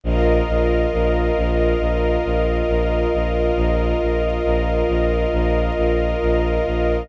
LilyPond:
<<
  \new Staff \with { instrumentName = "String Ensemble 1" } { \time 4/4 \key c \minor \tempo 4 = 68 <bes' ees'' f''>1~ | <bes' ees'' f''>1 | }
  \new Staff \with { instrumentName = "Pad 2 (warm)" } { \time 4/4 \key c \minor <f' bes' ees''>1~ | <f' bes' ees''>1 | }
  \new Staff \with { instrumentName = "Violin" } { \clef bass \time 4/4 \key c \minor bes,,8 bes,,8 bes,,8 bes,,8 bes,,8 bes,,8 bes,,8 bes,,8 | bes,,8 bes,,8 bes,,8 bes,,8 bes,,8 bes,,8 bes,,8 bes,,8 | }
>>